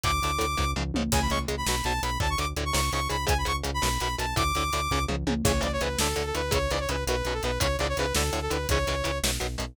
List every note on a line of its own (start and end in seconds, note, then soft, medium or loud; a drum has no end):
0.04 0.20 D2 loud
0.04 0.11 A2 medium
0.04 0.11 D3 medium
0.04 0.71 D6 medium
0.04 kick loud
0.04 closed hi-hat medium
0.22 0.38 D2 medium
0.22 0.31 A2 medium
0.22 0.31 D3 medium
0.22 closed hi-hat medium
0.39 0.56 D2 medium
0.39 0.46 A2 medium
0.39 0.46 D3 medium
0.39 closed hi-hat medium
0.57 0.74 C#2 loud
0.57 0.65 G#2 medium
0.57 0.65 C#3 medium
0.57 kick medium
0.76 0.92 C#2 loud
0.76 0.83 G#2 medium
0.76 0.83 C#3 medium
0.76 mid tom medium
0.94 1.10 C#2 medium
0.94 1.03 G#2 medium
0.94 1.03 C#3 medium
0.94 high tom loud
1.12 1.28 C#2 loud
1.12 1.20 C#3 medium
1.12 1.20 G#3 medium
1.12 1.21 G#5 medium
1.12 kick loud
1.12 crash loud
1.22 1.30 B5 medium
1.30 1.46 C#2 loud
1.30 1.38 C#3 medium
1.30 1.38 G#3 medium
1.30 1.39 C#6 medium
1.30 closed hi-hat medium
1.48 1.64 C#2 medium
1.48 1.55 C#3 medium
1.48 1.55 G#3 medium
1.48 closed hi-hat medium
1.57 1.66 B5 medium
1.66 1.82 B1 loud
1.66 1.76 B2 medium
1.66 1.76 F#3 medium
1.66 1.84 B5 medium
1.66 snare loud
1.84 2.00 B1 loud
1.84 1.93 B2 medium
1.84 1.93 F#3 medium
1.84 2.02 A5 medium
1.84 closed hi-hat medium
2.02 2.18 B1 loud
2.02 2.10 B2 medium
2.02 2.10 F#3 medium
2.02 2.18 B5 medium
2.02 closed hi-hat medium
2.20 2.36 D2 loud
2.20 2.27 A2 medium
2.20 2.27 D3 medium
2.20 2.30 A5 medium
2.20 kick loud
2.30 2.39 C#6 medium
2.38 2.54 D2 medium
2.38 2.45 A2 medium
2.38 2.45 D3 medium
2.38 2.48 D6 medium
2.38 closed hi-hat medium
2.57 2.72 D2 loud
2.57 2.64 A2 medium
2.57 2.64 D3 medium
2.57 closed hi-hat medium
2.65 2.74 C#6 medium
2.73 2.90 C#2 loud
2.73 2.81 G#2 medium
2.73 2.81 C#3 medium
2.73 2.91 C#6 medium
2.73 snare loud
2.92 3.08 C#2 loud
2.92 3.00 G#2 medium
2.92 3.00 C#3 medium
2.92 3.08 C#6 medium
2.92 closed hi-hat medium
3.09 3.26 C#2 medium
3.09 3.17 G#2 medium
3.09 3.17 C#3 medium
3.09 3.25 B5 medium
3.09 closed hi-hat medium
3.27 3.44 C#2 loud
3.27 3.34 G#2 loud
3.27 3.34 C#3 medium
3.27 3.37 G#5 medium
3.27 kick loud
3.27 closed hi-hat loud
3.38 3.47 B5 medium
3.45 3.62 C#2 medium
3.45 3.52 G#2 medium
3.45 3.52 C#3 medium
3.45 3.56 C#6 medium
3.45 closed hi-hat medium
3.64 3.80 C#2 loud
3.64 3.71 G#2 medium
3.64 3.71 C#3 medium
3.64 closed hi-hat medium
3.74 3.83 B5 medium
3.82 3.98 B1 loud
3.82 3.89 F#2 medium
3.82 3.89 B2 medium
3.82 4.00 B5 medium
3.82 snare loud
4.00 4.16 B1 medium
4.00 4.08 F#2 medium
4.00 4.08 B2 medium
4.00 4.16 B5 medium
4.00 closed hi-hat medium
4.18 4.34 B1 medium
4.18 4.26 F#2 medium
4.18 4.26 B2 medium
4.18 4.35 A5 medium
4.18 closed hi-hat medium
4.36 4.52 D2 loud
4.36 4.43 A2 medium
4.36 4.43 D3 medium
4.36 5.04 D6 medium
4.36 kick loud
4.36 closed hi-hat medium
4.55 4.70 D2 medium
4.55 4.64 A2 medium
4.55 4.64 D3 medium
4.55 closed hi-hat medium
4.73 4.88 D2 medium
4.73 4.81 A2 medium
4.73 4.81 D3 medium
4.73 closed hi-hat medium
4.91 5.06 C#2 loud
4.91 4.99 G#2 medium
4.91 4.99 C#3 medium
4.91 kick medium
5.08 5.24 C#2 loud
5.08 5.16 G#2 medium
5.08 5.16 C#3 medium
5.08 mid tom medium
5.27 5.42 C#2 medium
5.27 5.34 G#2 medium
5.27 5.34 C#3 medium
5.27 high tom loud
5.44 5.60 C#2 loud
5.44 5.52 G#2 medium
5.44 5.52 C#3 medium
5.44 5.52 E3 medium
5.44 5.62 C#5 medium
5.44 kick loud
5.44 crash loud
5.61 5.78 C#2 medium
5.61 5.68 G#2 medium
5.61 5.68 C#3 medium
5.61 5.68 E3 medium
5.61 5.72 D5 medium
5.61 closed hi-hat medium
5.73 5.81 C#5 medium
5.81 5.96 C#2 medium
5.81 5.88 G#2 medium
5.81 5.88 C#3 medium
5.81 5.88 E3 medium
5.81 5.98 B4 medium
5.81 closed hi-hat medium
5.99 6.14 D2 medium
5.99 6.08 A2 medium
5.99 6.08 D3 medium
5.99 6.25 A4 medium
5.99 snare loud
6.16 6.32 D2 medium
6.16 6.23 A2 medium
6.16 6.23 D3 medium
6.16 closed hi-hat medium
6.26 6.34 A4 medium
6.35 6.50 D2 medium
6.35 6.42 A2 medium
6.35 6.42 D3 medium
6.35 6.52 B4 medium
6.35 closed hi-hat medium
6.51 6.68 C#2 loud
6.51 6.58 G#2 medium
6.51 6.58 C#3 loud
6.51 6.58 E3 medium
6.51 6.71 C#5 medium
6.51 kick loud
6.51 closed hi-hat loud
6.71 6.86 C#2 medium
6.71 6.79 G#2 medium
6.71 6.79 C#3 medium
6.71 6.79 E3 medium
6.71 6.80 D5 medium
6.71 closed hi-hat medium
6.80 6.89 C#5 medium
6.89 7.04 C#2 medium
6.89 6.96 G#2 medium
6.89 6.96 C#3 medium
6.89 6.96 E3 medium
6.89 7.04 B4 medium
6.89 closed hi-hat medium
7.07 7.22 B1 loud
7.07 7.16 F#2 medium
7.07 7.16 B2 medium
7.07 7.34 B4 medium
7.07 closed hi-hat loud
7.25 7.40 B1 medium
7.25 7.34 F#2 medium
7.25 7.34 B2 medium
7.25 closed hi-hat medium
7.34 7.42 A4 medium
7.43 7.58 B1 loud
7.43 7.51 F#2 medium
7.43 7.51 B2 medium
7.43 7.59 B4 medium
7.43 closed hi-hat medium
7.60 7.76 C#2 loud
7.60 7.67 E2 medium
7.60 7.67 G#2 medium
7.60 7.67 C#3 medium
7.60 7.77 C#5 medium
7.60 kick loud
7.60 closed hi-hat loud
7.78 7.94 C#2 loud
7.78 7.87 E2 medium
7.78 7.87 G#2 medium
7.78 7.87 C#3 medium
7.78 7.87 D5 medium
7.78 closed hi-hat medium
7.89 7.97 C#5 medium
7.97 8.12 C#2 medium
7.97 8.06 E2 medium
7.97 8.06 G#2 medium
7.97 8.06 C#3 medium
7.97 8.14 B4 medium
7.97 closed hi-hat medium
8.14 8.30 D2 loud
8.14 8.23 A2 medium
8.14 8.23 D3 medium
8.14 8.40 A4 medium
8.14 snare loud
8.33 8.48 D2 medium
8.33 8.40 A2 medium
8.33 8.40 D3 medium
8.33 closed hi-hat medium
8.42 8.50 A4 medium
8.50 8.66 D2 medium
8.50 8.58 A2 medium
8.50 8.58 D3 medium
8.50 8.67 B4 medium
8.50 closed hi-hat medium
8.69 8.85 C#2 loud
8.69 8.78 G#2 medium
8.69 8.78 C#3 medium
8.69 8.78 E3 medium
8.69 9.18 C#5 medium
8.69 kick loud
8.69 closed hi-hat loud
8.87 9.02 C#2 medium
8.87 8.95 G#2 medium
8.87 8.95 C#3 medium
8.87 8.95 E3 medium
8.87 closed hi-hat medium
9.04 9.20 C#2 medium
9.04 9.11 G#2 medium
9.04 9.11 C#3 medium
9.04 9.11 E3 medium
9.04 closed hi-hat medium
9.23 9.38 B1 loud
9.23 9.31 F#2 medium
9.23 9.31 B2 medium
9.23 snare loud
9.40 9.57 B1 medium
9.40 9.47 F#2 medium
9.40 9.47 B2 medium
9.40 closed hi-hat medium
9.58 9.75 B1 medium
9.58 9.65 F#2 medium
9.58 9.65 B2 medium
9.58 closed hi-hat medium